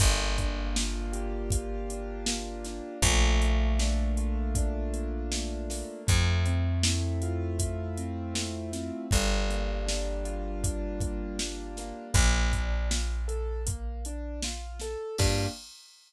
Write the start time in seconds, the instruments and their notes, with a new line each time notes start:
0.00 electric bass (finger) G1, acoustic grand piano A#3, kick, closed hi-hat
0.38 acoustic grand piano D4, kick, closed hi-hat
0.75 acoustic grand piano F4, snare
1.13 acoustic grand piano G4, closed hi-hat
1.50 acoustic grand piano F4, kick, closed hi-hat
1.90 acoustic grand piano D4, closed hi-hat
2.26 acoustic grand piano A#3, snare
2.65 acoustic grand piano D4, snare, closed hi-hat
3.02 electric bass (finger) A#1, acoustic grand piano A3, kick, closed hi-hat
3.42 acoustic grand piano A#3, closed hi-hat
3.79 acoustic grand piano D4, snare
4.17 acoustic grand piano F4, closed hi-hat
4.55 acoustic grand piano D4, kick, closed hi-hat
4.93 acoustic grand piano A#3, closed hi-hat
5.32 acoustic grand piano A3, snare
5.70 acoustic grand piano A#3, snare, open hi-hat
6.07 electric bass (finger) F2, acoustic grand piano A3, kick, closed hi-hat
6.46 acoustic grand piano C4, closed hi-hat
6.83 acoustic grand piano E4, snare
7.22 acoustic grand piano F4, closed hi-hat
7.59 acoustic grand piano E4, kick, closed hi-hat
7.97 acoustic grand piano C4, closed hi-hat
8.34 acoustic grand piano A3, snare
8.72 acoustic grand piano C4, snare, closed hi-hat
9.11 electric bass (finger) G1, acoustic grand piano G3, kick, closed hi-hat
9.50 acoustic grand piano A#3, closed hi-hat
9.86 acoustic grand piano D4, snare
10.25 acoustic grand piano F4, closed hi-hat
10.63 acoustic grand piano D4, kick, closed hi-hat
11.00 acoustic grand piano A#3, kick, closed hi-hat
11.39 acoustic grand piano G3, snare
11.77 acoustic grand piano A#3, snare, closed hi-hat
12.14 electric bass (finger) A#1, acoustic grand piano A#3, kick, closed hi-hat
12.53 acoustic grand piano D4, kick, closed hi-hat
12.91 acoustic grand piano F4, snare
13.28 acoustic grand piano A4, closed hi-hat
13.66 acoustic grand piano A#3, kick, closed hi-hat
14.05 acoustic grand piano D4, closed hi-hat
14.43 acoustic grand piano F4, snare
14.80 acoustic grand piano A4, snare, closed hi-hat
15.18 electric bass (finger) G2, acoustic grand piano A#3 D4 F4 G4, kick, crash